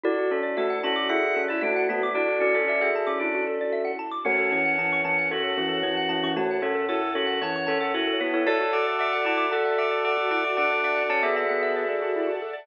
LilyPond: <<
  \new Staff \with { instrumentName = "Tubular Bells" } { \time 4/4 \key fis \minor \tempo 4 = 114 <fis' d''>8 <cis' a'>8 <a fis'>8 <cis' a'>8 <gis' e''>8 <cis' a'>8 <a fis'>8 <a fis'>16 <a fis'>16 | <fis' d''>8 <fis' d''>16 <cis' a'>16 <fis' d''>16 <gis' e''>8 <cis' a'>4.~ <cis' a'>16 r8 | <a fis'>8 <e cis'>8 <e cis'>8 <e cis'>8 <cis' a'>8 <e cis'>8 <e cis'>8 <e cis'>16 <e cis'>16 | <a fis'>8 <cis' a'>8 <e' cis''>8 <cis' a'>8 <e cis'>8 <cis' a'>8 <e' cis''>8 <e' cis''>16 <e' cis''>16 |
<cis'' a''>8 <fis'' d'''>8 <fis'' d'''>8 <fis'' d'''>8 <a' fis''>8 <fis'' d'''>8 <fis'' d'''>8 <fis'' d'''>16 <fis'' d'''>16 | <fis'' d'''>8 <fis'' d'''>8 <cis'' a''>16 <gis' e''>16 <gis' e''>2 r8 | }
  \new Staff \with { instrumentName = "Drawbar Organ" } { \time 4/4 \key fis \minor r4 a'8 fis'8 fis''8. e'16 d'8 b8 | d'8 cis'4 r8 d'8 r4. | cis'4. cis'8 fis'2 | r4 a'8 fis'8 cis''8. a'16 fis'8 b8 |
a'4. e'8 a'2 | d'4 cis'16 b8 b8. r4. | }
  \new Staff \with { instrumentName = "Xylophone" } { \time 4/4 \key fis \minor e'16 fis'16 a'16 d''16 e''16 fis''16 a''16 d'''16 e'16 fis'16 a'16 d''16 e''16 fis''16 a''16 d'''16 | e'16 fis'16 a'16 d''16 e''16 fis''16 a''16 d'''16 e'16 fis'16 a'16 d''16 e''16 fis''16 a''16 d'''16 | fis'16 a'16 cis''16 fis''16 a''16 cis'''16 a''16 fis''16 cis''16 a'16 fis'16 a'16 cis''16 fis''16 a''16 cis'''16 | a''16 fis''16 cis''16 a'16 fis'16 a'16 cis''16 fis''16 a''16 cis'''16 a''16 fis''16 cis''16 a'16 fis'16 a'16 |
e'16 fis'16 a'16 d''16 e''16 fis''16 a''16 d'''16 a''16 fis''16 e''16 d''16 a'16 fis'16 e'16 fis'16 | a'16 d''16 e''16 fis''16 a''16 d'''16 a''16 fis''16 e''16 d''16 a'16 fis'16 e'16 fis'16 a'16 d''16 | }
  \new Staff \with { instrumentName = "Drawbar Organ" } { \clef bass \time 4/4 \key fis \minor d,1~ | d,1 | fis,1~ | fis,1 |
d,1~ | d,1 | }
  \new Staff \with { instrumentName = "String Ensemble 1" } { \time 4/4 \key fis \minor <d' e' fis' a'>1~ | <d' e' fis' a'>1 | <cis'' fis'' a''>1~ | <cis'' fis'' a''>1 |
<d'' e'' fis'' a''>1~ | <d'' e'' fis'' a''>1 | }
>>